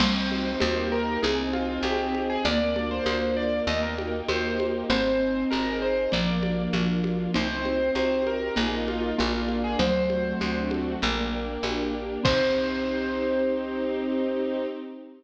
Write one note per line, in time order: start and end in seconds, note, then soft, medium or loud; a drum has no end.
0.00 0.56 C2 loud
0.00 0.52 G3 loud
0.00 0.58 C4 loud
0.00 0.49 C5 medium
0.00 0.61 C5 medium
0.00 0.61 D#5 medium
0.00 0.61 G5 medium
0.00 crash loud
0.00 low conga loud
0.31 0.61 D#4 medium
0.31 high conga medium
0.60 1.18 D#2 loud
0.60 1.19 A#3 loud
0.60 1.17 A#3 loud
0.60 1.17 D#4 loud
0.60 1.17 G4 loud
0.60 1.22 A#4 medium
0.60 0.87 C5 medium
0.60 1.22 D#5 medium
0.60 1.22 G5 medium
0.60 high conga loud
0.92 1.20 A#4 medium
1.23 1.79 C2 loud
1.23 2.14 C4 loud
1.23 2.31 D#4 medium
1.23 1.37 G#4 medium
1.23 2.44 C5 medium
1.23 2.44 D#5 medium
1.23 2.44 G#5 medium
1.23 low conga medium
1.53 2.41 D#4 medium
1.53 1.82 F4 medium
1.53 high conga medium
1.83 2.38 C2 medium
1.83 2.21 G4 medium
1.83 2.42 G#4 medium
1.83 high conga medium
2.14 2.43 C4 medium
2.14 high conga medium
2.30 2.44 G#4 medium
2.45 3.00 D2 loud
2.45 2.74 A#3 loud
2.45 3.36 A#3 loud
2.45 3.67 A#4 medium
2.45 2.89 D5 medium
2.45 3.67 D5 medium
2.45 3.67 F5 medium
2.45 low conga medium
2.76 4.21 A#3 loud
2.76 3.63 D4 medium
2.76 high conga medium
2.91 3.36 C5 medium
3.05 3.61 D2 loud
3.05 3.64 F4 medium
3.05 high conga medium
3.37 3.66 A#3 medium
3.37 3.62 D5 medium
3.67 4.22 D#2 loud
3.67 4.57 A#3 loud
3.67 4.89 A#4 medium
3.67 3.82 D#5 medium
3.67 4.89 D#5 medium
3.67 4.89 G5 medium
3.67 low conga medium
3.83 3.97 A#4 medium
3.98 4.85 D#4 medium
3.98 high conga medium
4.28 4.84 D#2 medium
4.28 4.86 G4 medium
4.28 4.66 C5 medium
4.28 high conga medium
4.58 4.87 A#3 medium
4.58 high conga medium
4.90 5.45 G#1 loud
4.90 5.67 C4 loud
4.90 5.81 C4 loud
4.90 5.44 C5 medium
4.90 6.11 C5 medium
4.90 6.11 D#5 medium
4.90 6.11 G#5 medium
4.90 low conga loud
5.21 6.08 D#4 medium
5.50 6.08 G#1 loud
5.50 6.08 G#4 medium
5.50 5.78 A#4 medium
5.50 high conga medium
5.82 6.11 C4 medium
5.82 6.11 C5 medium
6.12 6.68 A#1 loud
6.12 6.70 F3 loud
6.12 7.04 A#3 loud
6.12 7.33 A#4 medium
6.12 7.33 D5 medium
6.12 6.63 D5 medium
6.12 7.33 F5 medium
6.12 low conga medium
6.43 7.30 D4 medium
6.43 high conga medium
6.73 7.28 A#1 medium
6.73 7.34 F3 loud
6.73 7.31 F4 medium
6.73 high conga medium
7.04 7.33 A#3 medium
7.04 high conga medium
7.34 7.91 C2 loud
7.34 8.26 C4 loud
7.34 8.23 D#4 loud
7.34 8.56 C5 medium
7.34 7.91 C5 medium
7.34 8.56 D#5 medium
7.34 8.56 G5 medium
7.34 low conga loud
7.64 8.51 D#4 medium
7.64 high conga medium
7.95 8.50 C2 medium
7.95 8.54 G4 medium
7.95 8.25 C5 medium
7.95 high conga medium
8.27 8.56 C4 medium
8.27 8.53 A#4 medium
8.27 high conga medium
8.56 9.13 A#1 loud
8.56 9.09 A#3 loud
8.56 9.13 A#3 loud
8.56 9.13 D#4 loud
8.56 9.13 F4 loud
8.56 8.72 G#4 medium
8.56 9.17 A#4 medium
8.56 9.18 D#5 medium
8.56 9.17 F5 medium
8.56 low conga medium
8.88 9.13 F4 medium
8.88 high conga medium
9.17 9.76 A#1 loud
9.17 9.73 A#3 loud
9.17 9.78 A#3 loud
9.17 9.56 F4 medium
9.17 9.78 A#4 medium
9.17 9.78 D5 medium
9.17 9.78 F5 medium
9.17 high conga medium
9.48 9.77 D4 medium
9.48 high conga medium
9.64 9.79 G#4 medium
9.79 10.34 D2 loud
9.79 11.46 F#3 loud
9.79 10.95 A3 loud
9.79 11.00 A4 medium
9.79 11.00 C5 medium
9.79 10.57 C5 medium
9.79 11.00 D5 medium
9.79 11.00 F#5 medium
9.79 low conga medium
10.10 10.98 C4 medium
10.10 high conga medium
10.40 10.96 D2 loud
10.40 10.98 D4 medium
10.40 high conga medium
10.71 11.00 F#4 medium
10.71 high conga medium
11.02 11.58 A#1 loud
11.02 11.93 A#3 loud
11.02 12.24 A#4 medium
11.02 12.24 D5 medium
11.02 12.24 G5 medium
11.02 low conga medium
11.34 12.21 D4 medium
11.63 12.18 A#1 medium
11.63 12.21 G4 medium
11.63 high conga medium
11.93 12.23 A#3 medium
12.23 14.67 C2 loud
12.23 14.65 C4 loud
12.23 14.66 C4 loud
12.23 14.66 D#4 loud
12.23 14.66 G4 medium
12.23 14.66 G4 loud
12.23 14.66 C5 loud
12.23 kick loud
12.23 crash loud